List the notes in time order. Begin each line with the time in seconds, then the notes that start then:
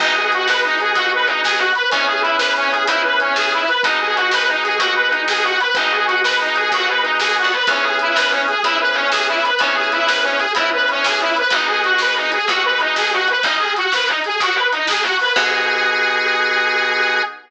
0.00 G#1 B3 D#4 F#4 G#4, kick, crash
0.16 G#4
0.32 F#4, closed hi-hat
0.47 G#1 B4, snare
0.64 D#4
0.80 G#4, closed hi-hat
0.95 D#2 F#4, kick, closed hi-hat
1.14 B4
1.26 D#4, closed hi-hat
1.44 G#1 G#4, snare
1.58 F#4
1.75 B4, closed hi-hat
1.91 C#2 B3 C#4 E4 G#4, kick, closed hi-hat
2.07 G#4
2.22 E4, closed hi-hat
2.38 C#2 B4, snare
2.57 C#4
2.71 G#4, closed hi-hat
2.87 G#2 E4, kick, closed hi-hat
3.04 B4
3.20 C#4, closed hi-hat
3.36 C#2 G#4, snare
3.53 E4
3.68 B4, closed hi-hat
3.83 G#1 B3 D#4 F#4 G#4, kick, closed hi-hat
4.01 G#4
4.16 F#4, closed hi-hat
4.31 G#1 B4, snare
4.49 D#4
4.63 G#4, closed hi-hat
4.79 D#2 F#4, kick, closed hi-hat
4.96 B4
5.10 D#4, closed hi-hat
5.28 G#1 G#4, snare
5.44 F#4
5.60 B4, closed hi-hat
5.74 G#1 B3 D#4 F#4 G#4, kick, closed hi-hat
5.91 G#4
6.07 F#4, closed hi-hat
6.24 G#1 B4, snare
6.41 D#4
6.56 G#4, closed hi-hat
6.72 D#2 F#4, kick, closed hi-hat
6.88 B4
7.03 D#4, closed hi-hat
7.20 D#2 G#4, snare
7.38 F#4
7.44 D2
7.52 B4, closed hi-hat
7.67 C#2 B3 C#4 E4 G#4, kick, closed hi-hat
7.83 G#4
7.99 E4, closed hi-hat
8.16 G#2 B4, snare
8.30 C#4
8.48 G#4, closed hi-hat
8.63 G#2 B3 C#4 E4 G#4, kick, closed hi-hat
8.80 B4
8.94 C#4, closed hi-hat
9.12 C#2 G#4, snare
9.28 E4
9.44 B4, closed hi-hat
9.59 C#2 B3 C#4 E4 G#4, kick, closed hi-hat
9.75 G#4
9.92 E4, closed hi-hat
10.08 G#2 B4, snare
10.24 C#4
10.38 G#4, closed hi-hat
10.55 G#2 B3 C#4 E4 G#4, kick, closed hi-hat
10.73 B4
10.88 C#4, closed hi-hat
11.04 C#2 G#4, snare
11.21 E4
11.36 B4, closed hi-hat
11.50 G#1 B3 D#4 F#4 G#4, kick, closed hi-hat
11.68 G#4
11.83 F#4, closed hi-hat
11.98 D#2 B4, snare
12.16 D#4
12.32 G#4, closed hi-hat
12.48 D#2 B3 D#4 F#4 G#4, kick, closed hi-hat
12.65 B4
12.80 D#4, closed hi-hat
12.96 G#1 G#4, snare
13.13 F#4
13.28 B4, closed hi-hat
13.42 G#1 D#4, kick, closed hi-hat
13.59 G#4
13.76 F#4, closed hi-hat
13.92 D#2 B4, snare
14.07 D#4
14.24 G#4, closed hi-hat
14.40 D#2 F#4, kick, closed hi-hat
14.54 B4
14.72 D#4, closed hi-hat
14.87 G#1 G#4, snare
15.02 F#4
15.19 B4, open hi-hat
15.36 G#2 B3 D#4 F#4 G#4, kick, crash